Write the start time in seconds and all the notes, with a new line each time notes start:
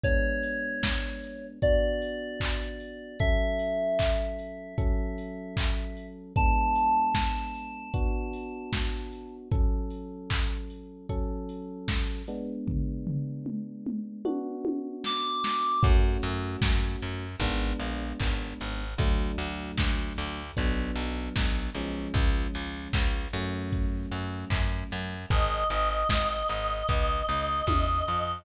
0.04 G#3 B3 D4 C#5, kick, closed hi-hat
0.43 open hi-hat
0.83 kick, snare
1.23 open hi-hat
1.62 B3 D4 F#4 D5, kick, closed hi-hat
2.02 open hi-hat
2.40 kick, clap
2.80 open hi-hat
3.20 F#3 C#4 A4 E5, kick, closed hi-hat
3.59 open hi-hat
3.99 kick, clap
4.39 open hi-hat
4.78 F#3 C#4 A4, kick, closed hi-hat
5.18 open hi-hat
5.57 kick, clap
5.97 open hi-hat
6.36 G#3 B3 D4 A5, kick, closed hi-hat
6.75 open hi-hat
7.14 kick, snare
7.54 open hi-hat
7.94 B3 D4 F#4, kick, closed hi-hat
8.33 open hi-hat
8.73 kick, snare
9.12 open hi-hat
9.51 F#3 C#4 A4, kick, closed hi-hat
9.90 open hi-hat
10.30 kick, clap
10.70 open hi-hat
11.09 F#3 C#4 A4, kick, closed hi-hat
11.49 open hi-hat
11.88 kick, snare
12.28 G#3 B3 D4, open hi-hat
12.67 kick, floor tom
13.07 floor tom
13.46 mid tom
13.87 mid tom
14.25 B3 D4 F#4, high tom
14.65 high tom
15.04 D6, snare
15.44 snare
15.83 F#2 A3 C#4 F#4, kick, crash
16.22 F#2, open hi-hat
16.62 F#2, kick, snare
17.02 F#2, open hi-hat
17.40 G#1 G#3 B3 D4, kick, closed hi-hat
17.80 A#1, open hi-hat
18.20 G#1, kick, clap
18.60 G#1, open hi-hat
18.98 D2 F#3 A3 D4, kick, closed hi-hat
19.38 D2, open hi-hat
19.78 D2, kick, snare
20.17 D2, open hi-hat
20.57 B1 F#3 B3 D4, kick, closed hi-hat
20.96 B1, open hi-hat
21.36 B1, kick, snare
21.75 B1 F3 G#3 C#4, open hi-hat
22.14 C#2, kick, closed hi-hat
22.54 C#2, open hi-hat
22.93 C#2, kick, snare
23.33 F#2 F#3 A3 C#4, open hi-hat
23.72 kick, closed hi-hat
24.12 F#2, open hi-hat
24.50 F#2, kick, clap
24.91 F#2, open hi-hat
25.30 G#1 D#5, kick, closed hi-hat
25.70 G#1, open hi-hat
26.09 G#1, kick, snare
26.48 G#1, open hi-hat
26.88 C#2, kick, closed hi-hat
27.28 C#2, open hi-hat
27.67 E2, kick, high tom
28.08 F2